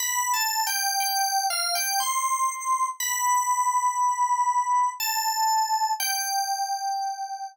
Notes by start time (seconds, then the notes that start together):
0.00 B5
0.34 A5
0.67 G5
1.00 G5
1.50 F5
1.75 G5
2.00 C6
3.00 B5
5.00 A5
6.00 G5